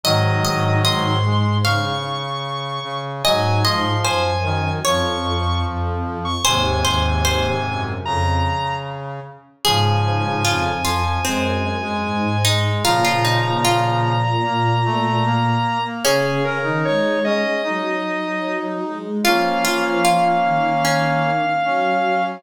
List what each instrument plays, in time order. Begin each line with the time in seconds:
0.04 violin G#2, brass section D#3 F#3, pizzicato strings D#5, lead 1 (square) D#5
0.45 pizzicato strings D#5
0.85 pizzicato strings D#5, lead 1 (square) C6
1.25 brass section G#3
1.64 brass section C#3, pizzicato strings F5, lead 1 (square) C#6
2.84 brass section C#3
3.24 violin G#2, brass section F#3, pizzicato strings D#5, lead 1 (square) G#5
3.64 brass section F3, pizzicato strings D#5, lead 1 (square) C6
4.04 violin F#2, pizzicato strings C5, lead 1 (square) G#5
4.44 brass section D#3
4.84 violin F2, brass section F3, pizzicato strings C#5, lead 1 (square) C#6
5.64 violin F2
6.25 lead 1 (square) C#6
6.45 violin D#2, brass section G#2 C3, pizzicato strings C5, lead 1 (square) G#5
6.84 violin D#2, pizzicato strings C5
7.25 pizzicato strings C5
7.66 violin F#2
8.05 violin F2, brass section C#3, lead 1 (square) A#5
9.65 violin G#2, brass section C#3 F3, pizzicato strings G#4, lead 1 (square) G#5
10.45 violin F2, pizzicato strings F4
10.85 brass section F3, pizzicato strings F4
11.24 violin F#2, brass section G#3, pizzicato strings C4
11.83 brass section G#3
12.04 violin G#2
12.45 brass section G#3, pizzicato strings D#4
12.85 violin A#2, brass section C#3 F3, pizzicato strings F4, lead 1 (square) A#5
13.05 pizzicato strings F4
13.25 pizzicato strings D#4
13.65 pizzicato strings F4
14.44 brass section A#3
14.85 brass section A3
15.25 brass section A#3
15.85 brass section A#3
16.05 violin C#3, pizzicato strings C#4, brass section C#4, lead 1 (square) G#4
16.45 lead 1 (square) A#4
16.64 violin D#3, brass section D#4
16.85 violin G#3, lead 1 (square) C#5
17.25 brass section C#4, lead 1 (square) D#5
17.64 violin F#3, brass section D#4
18.83 violin G#3
19.24 violin F3, brass section A#3 C#4, pizzicato strings F4, lead 1 (square) F5
19.65 pizzicato strings F4
20.05 pizzicato strings F4
20.44 violin D#3
20.85 pizzicato strings C#4
21.65 violin F#3, brass section C#4